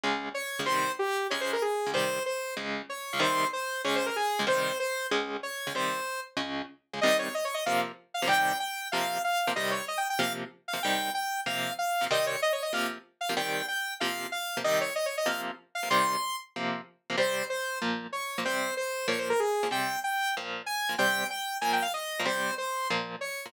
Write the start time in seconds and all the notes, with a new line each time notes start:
0.04 C#2 C#3 G#3
0.34 C#5
0.59 C#2 C#3 G#3
0.66 C3 D#3 G3 C5
0.99 G4
1.30 C#2 C#3 G#3 C#5
1.41 C5
1.53 A#4
1.62 G#4
1.86 C#2 C#3 G#3
1.94 C3 D#3 G3 C5
2.26 C5
2.57 C#2 C#3 G#3
2.89 C#5
3.13 C#2 C#3 G#3
3.20 C3 D#3 G3 C5
3.53 C5
3.85 C#2 C#3 G#3 C#5
3.96 C5
4.06 A#4
4.16 G#4
4.39 C#2 C#3 G#3
4.47 C3 D#3 G3 C5
4.80 C5
5.11 C#2 C#3 G#3
5.43 C#5
5.67 C#2 C#3 G#3
5.75 C3 D#3 G3 C5
6.37 C#2 C#3 G#3
6.93 C#2 C#3 G#3
7.01 C3 D#3 G3 D#5
7.19 C#5
7.34 D#5
7.45 C#5
7.54 D#5
7.66 C3 F3 A#3 F5
8.14 F5
8.22 C3 F3 A#3
8.28 C3 D#3 G3 G5
8.60 G5
8.92 C3 F3 A#3 F5
9.24 F5
9.47 C3 F3 A#3
9.56 C3 D#3 G3 D#5
9.71 C#5
9.88 D#5
9.98 G5
10.10 G5
10.19 C3 F3 A#3 F5
10.68 F5
10.73 C3 F3 A#3
10.83 C3 D#3 G3 G5
11.14 G5
11.46 C3 F3 A#3 F5
11.79 F5
12.01 C3 F3 A#3
12.11 C3 D#3 G3 D#5
12.27 C#5
12.42 D#5
12.53 C#5
12.62 D#5
12.73 C3 F3 A#3 F5
13.21 F5
13.29 C3 F3 A#3
13.37 C3 D#3 G3 G5
13.68 G5
14.00 C3 F3 A#3 F5
14.32 F5
14.57 C3 F3 A#3
14.64 C3 D#3 G3 D#5
14.81 C#5
14.96 D#5
15.06 C#5
15.17 D#5
15.26 C3 F3 A#3 F5
15.75 F5
15.83 C3 F3 A#3
15.90 C3 D#3 G3 C6
16.56 C3 F3 A#3
17.10 C3 F3 A#3
17.18 C3 G3 C4 C5
17.50 C5
17.82 A#2 F3 A#3
18.12 C#5
18.38 A#2 F3 A#3
18.45 C3 G3 C4 C5
18.77 C5
19.08 A#2 F3 A#3 C#5
19.18 C5
19.30 A#4
19.40 G#4
19.63 A#2 F3 A#3
19.71 C3 G3 C4 G5
20.04 G5
20.37 A#2 F3 A#3
20.66 G#5
20.89 A#2 F3 A#3
20.98 C3 G3 C4 G5
21.30 G5
21.61 A#2 F3 A#3 G#5
21.73 G5
21.82 F5
21.94 D#5
22.20 A#2 F3 A#3
22.26 C3 G3 C4 C5
22.58 C5
22.90 A#2 F3 A#3
23.21 C#5
23.46 A#2 F3 A#3